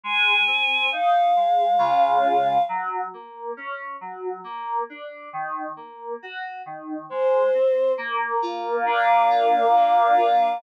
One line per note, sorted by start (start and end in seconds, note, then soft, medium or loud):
0.03 0.43 G#3 medium
0.03 0.90 G#5 medium
0.47 0.87 C4 medium
0.92 1.32 D#4 medium
0.92 2.62 F5 medium
1.36 1.76 G#3 medium
1.78 2.58 C#3 medium
1.78 2.58 G#3 medium
1.78 2.58 F4 medium
2.69 3.08 F#3 medium
3.14 3.53 A#3 medium
3.57 3.97 C#4 medium
4.01 4.40 F#3 medium
4.44 4.84 A#3 medium
4.90 5.29 D4 medium
5.33 5.73 D#3 medium
5.76 6.16 A#3 medium
6.22 6.62 F#4 medium
6.66 7.06 D#3 medium
7.09 7.50 G#3 medium
7.09 7.92 C5 medium
7.54 7.94 C4 medium
7.98 9.75 A#3 loud
8.42 9.30 F4 medium
8.86 10.54 D4 medium
8.86 10.58 F5 medium
9.30 10.16 F4 medium
9.76 10.60 A#3 medium
10.17 10.58 F4 medium